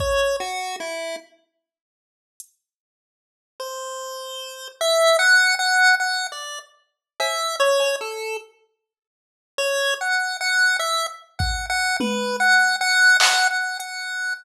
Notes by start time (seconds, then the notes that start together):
0.00 C#5, kick
0.40 F#4
0.80 E4
2.40 closed hi-hat
3.60 C5
4.81 E5
5.19 F#5
5.59 F#5
6.00 F#5
6.32 D5
7.20 E5, cowbell
7.60 C#5
7.80 cowbell
8.01 A4
9.58 C#5
10.01 F#5
10.41 F#5
10.79 E5
11.39 F#5, kick
11.70 F#5
12.00 B4, high tom
12.40 F#5
12.81 F#5
13.20 F#5, clap
13.51 F#5
13.79 F#5, closed hi-hat